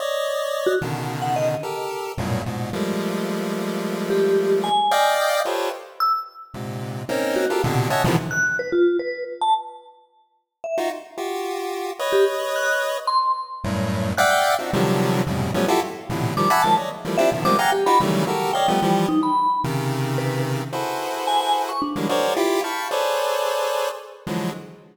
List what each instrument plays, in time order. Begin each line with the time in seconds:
0.00 lead 1 (square) C#5 D5 D#5
0.66 vibraphone F#4
0.81 lead 1 (square) B2 C#3 D3 D#3
1.22 vibraphone F#5
1.36 vibraphone D#5
1.63 lead 1 (square) G4 A4 A#4
2.18 lead 1 (square) F#2 G2 A2 A#2 B2
2.46 lead 1 (square) G#2 A#2 B2
2.73 lead 1 (square) F3 G3 G#3 A3 A#3
4.10 vibraphone G4
4.64 vibraphone G#5
4.91 lead 1 (square) D5 D#5 F5 G5
5.45 lead 1 (square) F4 G4 A4 B4 C5 C#5
6.00 vibraphone E6
6.54 lead 1 (square) G#2 A#2 C3
7.09 lead 1 (square) A#3 C4 C#4 D#4
7.36 vibraphone F#4
7.50 lead 1 (square) F4 G4 A4 A#4
7.64 lead 1 (square) A#2 B2 C3 D3
7.90 lead 1 (square) C#5 D#5 E5 F#5 G#5 A5
8.04 lead 1 (square) B2 C3 D3 D#3 E3 F3
8.31 vibraphone F#6
8.59 vibraphone B4
8.72 vibraphone F4
8.99 vibraphone B4
9.41 vibraphone A5
10.64 vibraphone E5
10.78 lead 1 (square) D#4 F4 F#4
11.18 lead 1 (square) F4 F#4 G4
11.99 lead 1 (square) B4 C#5 D#5
12.13 vibraphone G4
12.56 vibraphone F#6
13.07 vibraphone C6
13.64 lead 1 (square) F#2 G2 A2
14.18 lead 1 (square) D5 E5 F5 F#5 G5, vibraphone F#6
14.31 vibraphone G5
14.59 lead 1 (square) C4 D4 D#4 F4 F#4
14.73 lead 1 (square) C3 D3 D#3 F3 F#3 G3
15.27 lead 1 (square) F2 G2 A2 B2 C3 C#3
15.54 lead 1 (square) F3 F#3 G3 A3 B3 C#4
15.68 lead 1 (square) E4 F4 F#4 G4 A4
16.09 lead 1 (square) A2 A#2 B2 C3 D3 E3
16.37 lead 1 (square) D#3 F3 G3, vibraphone D6
16.50 lead 1 (square) E5 F#5 G#5 A5 B5
16.62 lead 1 (square) D#3 F3 F#3 G#3 A#3, vibraphone A5
16.77 lead 1 (square) C#5 D5 D#5
17.05 lead 1 (square) E3 F3 G3 A3 A#3
17.18 lead 1 (square) C4 D4 E4 F4 G4, vibraphone E5
17.32 lead 1 (square) B2 C3 D3 D#3 F3
17.45 lead 1 (square) F3 G3 G#3 A#3 B3 C4, vibraphone D6
17.59 lead 1 (square) F5 F#5 G#5 A#5, vibraphone G5
17.72 vibraphone G4
17.86 lead 1 (square) D#4 F4 F#4 G4, vibraphone B5
18.00 lead 1 (square) C#3 D#3 E3 F#3 G3 A3
18.27 lead 1 (square) F#4 G4 A4 A#4
18.53 lead 1 (square) C#5 D5 D#5 F5, vibraphone G5
18.68 lead 1 (square) F3 G3 A3 B3
18.82 lead 1 (square) E3 F3 G3
19.08 vibraphone D#4
19.23 vibraphone B5
19.64 lead 1 (square) C3 C#3 D#3
20.18 vibraphone B4
20.73 lead 1 (square) E4 F#4 G#4 A4 B4 C5
21.27 vibraphone G#5
21.40 vibraphone G#5
21.69 vibraphone C#6
21.82 vibraphone D4
21.96 lead 1 (square) D3 E3 F#3 G3 G#3 A#3
22.09 lead 1 (square) F#4 G#4 A#4 C5 C#5 D5
22.36 lead 1 (square) E4 F4 G4
22.64 lead 1 (square) F5 G5 A5 B5 C#6
22.91 lead 1 (square) G#4 A4 B4 C5 C#5 D5
24.27 lead 1 (square) D3 E3 F3 F#3 G#3